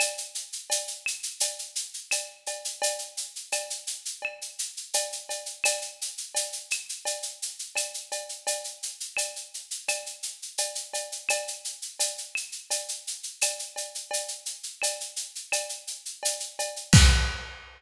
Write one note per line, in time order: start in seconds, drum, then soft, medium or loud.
0.00 cowbell medium
0.00 claves medium
0.00 shaker medium
0.18 shaker medium
0.35 shaker medium
0.52 shaker medium
0.70 cowbell medium
0.70 shaker medium
0.87 shaker medium
1.06 claves medium
1.06 shaker medium
1.23 shaker medium
1.40 cowbell medium
1.40 shaker loud
1.59 shaker medium
1.75 shaker medium
1.94 shaker medium
2.11 cowbell medium
2.11 claves medium
2.11 shaker medium
2.46 cowbell medium
2.46 shaker medium
2.65 shaker medium
2.82 cowbell medium
2.82 shaker medium
2.99 shaker medium
3.17 shaker medium
3.36 shaker medium
3.52 cowbell medium
3.52 claves medium
3.52 shaker medium
3.70 shaker medium
3.87 shaker medium
4.05 shaker medium
4.22 cowbell medium
4.22 claves medium
4.41 shaker medium
4.59 shaker medium
4.77 shaker medium
4.94 cowbell medium
4.94 shaker medium
5.12 shaker medium
5.29 cowbell medium
5.29 shaker medium
5.46 shaker medium
5.64 cowbell medium
5.64 claves medium
5.64 shaker loud
5.82 shaker medium
6.01 shaker medium
6.18 shaker medium
6.35 cowbell medium
6.35 shaker medium
6.52 shaker medium
6.71 claves medium
6.71 shaker medium
6.89 shaker medium
7.05 cowbell medium
7.05 shaker medium
7.22 shaker medium
7.42 shaker medium
7.59 shaker medium
7.75 cowbell medium
7.75 claves medium
7.75 shaker medium
7.94 shaker medium
8.12 cowbell medium
8.12 shaker medium
8.29 shaker medium
8.47 cowbell medium
8.47 shaker medium
8.64 shaker medium
8.83 shaker medium
9.00 shaker medium
9.17 cowbell medium
9.17 claves medium
9.17 shaker medium
9.36 shaker medium
9.54 shaker medium
9.71 shaker medium
9.88 cowbell medium
9.88 claves medium
9.88 shaker medium
10.06 shaker medium
10.23 shaker medium
10.42 shaker medium
10.58 cowbell medium
10.58 shaker medium
10.75 shaker medium
10.94 cowbell medium
10.94 shaker medium
11.12 shaker medium
11.29 cowbell medium
11.29 claves medium
11.29 shaker medium
11.48 shaker medium
11.65 shaker medium
11.82 shaker medium
11.99 cowbell medium
11.99 shaker loud
12.18 shaker medium
12.35 claves medium
12.35 shaker medium
12.52 shaker medium
12.70 cowbell medium
12.70 shaker medium
12.89 shaker medium
13.07 shaker medium
13.23 shaker medium
13.41 cowbell medium
13.41 claves medium
13.41 shaker loud
13.59 shaker medium
13.76 cowbell medium
13.76 shaker medium
13.95 shaker medium
14.11 cowbell medium
14.11 shaker medium
14.28 shaker medium
14.46 shaker medium
14.63 shaker medium
14.82 cowbell medium
14.82 claves medium
14.82 shaker medium
15.00 shaker medium
15.16 shaker medium
15.35 shaker medium
15.52 cowbell medium
15.52 claves medium
15.52 shaker medium
15.69 shaker medium
15.87 shaker medium
16.05 shaker medium
16.23 cowbell medium
16.23 shaker medium
16.40 shaker medium
16.59 cowbell medium
16.59 shaker medium
16.76 shaker medium
16.93 kick loud
16.93 crash loud